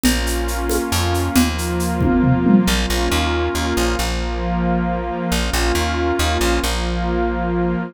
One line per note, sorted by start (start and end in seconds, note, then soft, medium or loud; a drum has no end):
0.03 0.79 A#1 loud
0.03 1.35 A#3 medium
0.03 1.35 C#4 medium
0.03 1.35 F4 medium
0.03 low conga medium
0.03 shaker medium
0.26 shaker medium
0.48 shaker medium
0.70 high conga medium
0.70 shaker medium
0.92 1.29 F2 loud
0.92 shaker medium
1.14 shaker medium
1.35 2.48 D#2 medium
1.35 2.67 F3 medium
1.35 2.66 A#3 medium
1.35 2.66 F4 medium
1.35 low conga loud
1.35 shaker medium
1.58 shaker medium
1.80 shaker medium
2.01 kick medium
2.01 high tom medium
2.23 floor tom medium
2.46 mid tom loud
2.67 2.86 A#1 loud
2.67 3.97 A#3 medium
2.67 3.97 C#4 medium
2.67 3.97 F4 medium
2.90 3.09 A#1 medium
3.12 3.49 D#2 loud
3.55 3.74 D#2 medium
3.77 3.96 A#1 medium
3.99 5.11 A#1 medium
3.99 5.30 F3 medium
3.99 5.30 A#3 medium
3.99 5.30 F4 medium
5.31 5.50 A#1 loud
5.31 6.61 A#3 medium
5.31 6.61 C#4 medium
5.31 6.61 F4 medium
5.53 5.72 A#1 loud
5.75 6.12 D#2 medium
6.19 6.38 D#2 loud
6.41 6.60 A#1 medium
6.62 7.76 A#1 loud
6.62 7.93 F3 medium
6.62 7.93 A#3 medium
6.62 7.93 F4 medium